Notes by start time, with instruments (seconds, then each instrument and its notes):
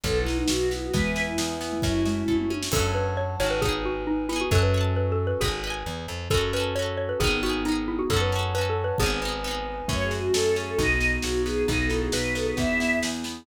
0.04 electric bass (finger) B1, xylophone F#3, acoustic guitar (steel) B3, choir aahs A4, pad 2 (warm) B4 D#5 F#5, kick, snare
0.20 choir aahs E4
0.26 acoustic guitar (steel) D#4, snare
0.34 choir aahs D#4
0.48 electric bass (finger) B1, acoustic guitar (steel) F#4, choir aahs F#4, snare
0.70 acoustic guitar (steel) B3, choir aahs E4, snare
0.82 choir aahs F#4
0.93 electric bass (finger) E2, xylophone E3 G#3, acoustic guitar (steel) B3, choir aahs B4, pad 2 (warm) B4 E5 G#5, kick, snare
1.16 acoustic guitar (steel) E4, snare
1.26 choir aahs E4
1.37 electric bass (finger) E2, choir aahs E4, acoustic guitar (steel) G#4, snare
1.60 acoustic guitar (steel) B3, choir aahs E4, snare
1.72 xylophone A3
1.82 electric bass (finger) F#2, xylophone F#3, pad 2 (warm) A3 C#4 F#4, acoustic guitar (steel) C#4, choir aahs E4, kick, snare
2.06 xylophone G#3, acoustic guitar (steel) F#4, snare
2.28 electric bass (finger) F#2, acoustic guitar (steel) A4, kick
2.38 mid tom
2.50 acoustic guitar (steel) C#4, high tom
2.63 snare
2.72 electric bass (finger) F#2, acoustic guitar (steel) C#4, xylophone A4, pad 2 (warm) C#5 F#5 A5, kick, crash
2.76 acoustic guitar (steel) F#4 A4
2.95 xylophone B4
3.17 xylophone C#5
3.40 electric bass (finger) G#1, acoustic guitar (steel) C#4 F#4, xylophone C#5
3.46 acoustic guitar (steel) A4
3.50 xylophone B4
3.62 acoustic guitar (steel) B3 D#4, xylophone G#4, pad 2 (warm) B4 D#5 G#5, kick
3.69 acoustic guitar (steel) G#4
3.85 xylophone F#4
4.07 xylophone D#4
4.29 acoustic guitar (steel) B3 D#4, xylophone E4
4.36 acoustic guitar (steel) G#4
4.41 xylophone F#4
4.50 electric bass (finger) F#2, pad 2 (warm) C#4 F#4 A4, xylophone A4, acoustic guitar (steel) C#5, kick
4.55 acoustic guitar (steel) F#5 A5
4.63 xylophone B4
4.74 acoustic guitar (steel) C#5 F#5
4.81 acoustic guitar (steel) A5
4.96 xylophone B4
5.12 xylophone A4
5.27 xylophone B4
5.41 electric bass (finger) G#1, xylophone G#4, acoustic guitar (steel) B4, kick
5.45 acoustic guitar (steel) D#5 G#5
5.64 acoustic guitar (steel) B4 D#5
5.70 acoustic guitar (steel) G#5
5.86 electric bass (finger) E2
6.08 electric bass (finger) F2
6.30 electric bass (finger) F#2, acoustic guitar (steel) C#4 F#4, pad 2 (warm) C#4 F#4 A4, xylophone A4, kick
6.37 acoustic guitar (steel) A4
6.53 acoustic guitar (steel) C#4 F#4, xylophone B4
6.60 acoustic guitar (steel) A4
6.75 acoustic guitar (steel) C#4 F#4, xylophone C#5
6.82 acoustic guitar (steel) A4
6.97 xylophone C#5
7.09 xylophone B4
7.20 electric bass (finger) G#1, pad 2 (warm) B3 D#4 G#4, acoustic guitar (steel) B3, xylophone G#4, kick
7.24 acoustic guitar (steel) D#4 G#4
7.43 acoustic guitar (steel) B3 D#4, xylophone F#4
7.49 acoustic guitar (steel) G#4
7.65 acoustic guitar (steel) B3 D#4, xylophone D#4
7.72 acoustic guitar (steel) G#4
7.88 xylophone E4
7.99 xylophone F#4
8.10 electric bass (finger) F#2, acoustic guitar (steel) C#4 F#4, xylophone A4, pad 2 (warm) C#5 F#5 A5, kick
8.17 acoustic guitar (steel) A4
8.21 xylophone B4
8.32 acoustic guitar (steel) C#4 F#4
8.39 acoustic guitar (steel) A4
8.55 acoustic guitar (steel) C#4 F#4, xylophone B4
8.61 acoustic guitar (steel) A4
8.70 xylophone A4
8.84 xylophone B4
8.98 electric bass (finger) G#1, acoustic guitar (steel) B3, xylophone G#4, pad 2 (warm) B4 D#5 G#5, kick
9.03 acoustic guitar (steel) D#4 G#4
9.22 acoustic guitar (steel) B3 D#4
9.28 acoustic guitar (steel) G#4
9.44 acoustic guitar (steel) B3 D#4
9.51 acoustic guitar (steel) G#4
9.88 electric bass (finger) F#2, xylophone F#3 A3, pad 2 (warm) A3 C#4 F#4, acoustic guitar (steel) C#4, choir aahs C#5, kick, snare
10.04 choir aahs G#4
10.11 acoustic guitar (steel) F#4, snare
10.19 choir aahs F#4
10.34 electric bass (finger) F#2, choir aahs A4, acoustic guitar (steel) A4, snare
10.56 acoustic guitar (steel) C#4, choir aahs G#4, snare
10.67 choir aahs A4
10.78 electric bass (finger) B1, acoustic guitar (steel) B3, pad 2 (warm) B3 D#4 F#4, xylophone D#4 F#4, choir aahs D#5, kick, snare
11.01 acoustic guitar (steel) D#4, snare
11.13 choir aahs G#4
11.22 electric bass (finger) B1, acoustic guitar (steel) F#4, choir aahs F#4, snare
11.45 acoustic guitar (steel) B3, choir aahs G#4, snare
11.67 electric bass (finger) B1, pad 2 (warm) B3 D#4 F#4, acoustic guitar (steel) B3, xylophone D#4, choir aahs D#5, kick, snare
11.83 choir aahs A4
11.90 acoustic guitar (steel) D#4, xylophone E4, snare
11.98 choir aahs G#4
12.12 electric bass (finger) B1, acoustic guitar (steel) F#4, choir aahs B4, xylophone B4, snare
12.35 acoustic guitar (steel) B3, choir aahs A4, xylophone B4, snare
12.46 xylophone G#4, choir aahs B4
12.57 electric bass (finger) E2, xylophone B3, pad 2 (warm) B3 E4 G#4, acoustic guitar (steel) B3, choir aahs E5, kick, snare
12.80 xylophone B3, acoustic guitar (steel) E4, snare
13.03 electric bass (finger) E2, acoustic guitar (steel) G#4, snare
13.24 acoustic guitar (steel) B3, snare